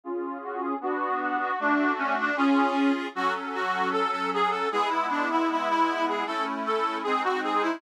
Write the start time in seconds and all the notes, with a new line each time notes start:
0.04 C#4 F4 G#4
0.43 F#4
0.61 G#4
0.81 B3 D4 F#4
1.21 F#4
1.41 F#4
1.59 A3 D4 F#4
1.98 C#4
2.20 D4
2.37 C#4 F4 G#4
3.15 F#3 C#4 F#4 A4
3.54 F#4
3.92 A4
4.11 A4
4.34 G#4
4.50 A4
4.71 G#3 B3 E4 G#4
4.90 E4
5.10 D4
5.31 E4
5.51 E4
5.69 E4
6.08 G#4
6.26 A3 C#4 E4 A4
6.66 A4
7.03 G#3 C4 D#4 G#4
7.24 F#4
7.43 G#4
7.62 E4